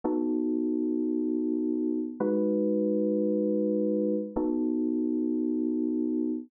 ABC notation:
X:1
M:4/4
L:1/8
Q:1/4=111
K:E
V:1 name="Electric Piano 2"
[B,DFA]8 | [G,DFB]8 | [B,DFA]8 |]